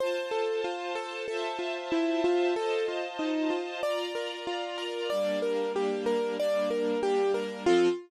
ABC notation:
X:1
M:4/4
L:1/8
Q:1/4=94
K:F
V:1 name="Acoustic Grand Piano"
c A F A A F E F | A F _E F d B F B | d B G B d B G B | F2 z6 |]
V:2 name="String Ensemble 1"
[Fca]4 [Fcea]4 | [Fc_ea]4 [Fdb]4 | [G,B,D]4 [G,B,D]4 | [F,CA]2 z6 |]